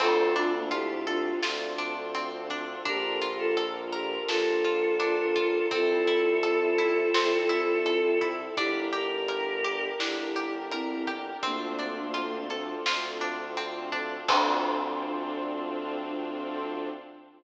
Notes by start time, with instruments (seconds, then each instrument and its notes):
0.00 violin D2, pizzicato strings C4, string ensemble 1 C4 D4 F4 A4, choir aahs F4 A4, kick, crash
0.35 choir aahs D4 F4, pizzicato strings D4, closed hi-hat
0.55 choir aahs A#3 D4
0.71 choir aahs E4 G4, pizzicato strings F4, closed hi-hat
1.07 choir aahs D4 F4, pizzicato strings A4, closed hi-hat
1.43 violin D2, pizzicato strings F4, snare
1.78 pizzicato strings D4, closed hi-hat
2.15 pizzicato strings C4, closed hi-hat
2.50 pizzicato strings D4, kick, closed hi-hat
2.85 violin A#1, pizzicato strings D4, string ensemble 1 D4 F4 A4 A#4, choir aahs G4 A#4, kick, closed hi-hat
3.21 pizzicato strings F4, closed hi-hat
3.38 choir aahs F4 A4
3.57 pizzicato strings A4, closed hi-hat
3.92 choir aahs G4 A#4, pizzicato strings A#4, closed hi-hat
4.28 violin A#1, choir aahs F4 A4, pizzicato strings A4, snare
4.64 pizzicato strings F4, closed hi-hat
5.00 pizzicato strings D4, closed hi-hat
5.36 pizzicato strings F4, kick, closed hi-hat
5.71 violin C2, pizzicato strings C4, string ensemble 1 C4 E4 A4, choir aahs F4 A4, kick, closed hi-hat
6.07 pizzicato strings E4, closed hi-hat
6.43 pizzicato strings A4, closed hi-hat
6.78 pizzicato strings E4, closed hi-hat
7.14 violin C2, pizzicato strings C4, snare
7.49 pizzicato strings E4, closed hi-hat
7.86 pizzicato strings A4, closed hi-hat
8.21 pizzicato strings E4, kick, closed hi-hat
8.57 violin G1, pizzicato strings D4, string ensemble 1 D4 G4 A#4, choir aahs E4 G4, kick, closed hi-hat
8.93 pizzicato strings G4, choir aahs G4 A#4, closed hi-hat
9.28 pizzicato strings A#4, closed hi-hat
9.64 pizzicato strings G4, closed hi-hat
9.98 violin G1, pizzicato strings D4, choir aahs E4 G4, snare
10.36 pizzicato strings G4, closed hi-hat
10.71 choir aahs C4 E4, pizzicato strings A#4, closed hi-hat
11.07 pizzicato strings G4, kick, closed hi-hat
11.43 violin D2, choir aahs A#3 D4, string ensemble 1 C4 D4 F4 A4, pizzicato strings C4, kick, closed hi-hat
11.79 pizzicato strings D4, closed hi-hat
12.14 pizzicato strings F4, closed hi-hat
12.50 pizzicato strings A4, closed hi-hat
12.86 violin D2, pizzicato strings F4, snare
13.21 pizzicato strings D4, closed hi-hat
13.57 pizzicato strings C4, closed hi-hat
13.92 pizzicato strings D4, kick, closed hi-hat
14.28 violin D2, pizzicato strings C4 D4 F4 A4, string ensemble 1 C4 D4 F4 A4, choir aahs D4, kick, crash